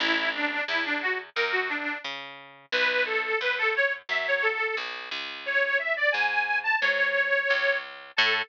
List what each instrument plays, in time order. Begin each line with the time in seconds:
0.00 electric bass (finger) A1, accordion E4
0.35 accordion D4
0.68 electric bass (finger) E2, accordion E4
0.85 accordion D4
1.02 accordion F#4
1.36 electric bass (finger) F#2, accordion A#4
1.52 accordion F#4
1.69 accordion D4
2.04 electric bass (finger) C#3
2.72 electric bass (finger) B1, accordion B4
3.06 accordion A4
3.41 electric bass (finger) F#2, accordion B4
3.58 accordion A4
3.76 accordion C#5
4.09 electric bass (finger) F#2, accordion E5
4.28 accordion C#5
4.42 accordion A4
4.77 electric bass (finger) B1
5.11 electric bass (finger) C#2
5.46 accordion C#5
5.79 accordion E5
5.97 accordion D5
6.12 electric bass (finger) G#2, accordion G#5
6.63 accordion A5
6.81 electric bass (finger) G#2, accordion C#5
7.50 electric bass (finger) C#2
8.16 electric bass (finger) A2, accordion A4